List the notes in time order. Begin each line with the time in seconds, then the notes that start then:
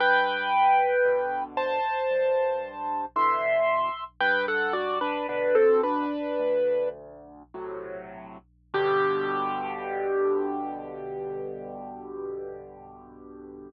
0.00 G2 B4 G5
1.05 B2 D3
1.57 C5 A5
2.11 G2
3.16 B2 D3 E3 E5 C6
4.20 G2 B4 G5
4.48 A4 F#5
4.73 F#4 D5
5.01 D4 B4
5.28 B2 D3 D4 B4
5.55 C4 A4
5.83 D4 B4
6.39 D2
7.54 A2 C3 F#3
8.74 G2 B2 D3 G4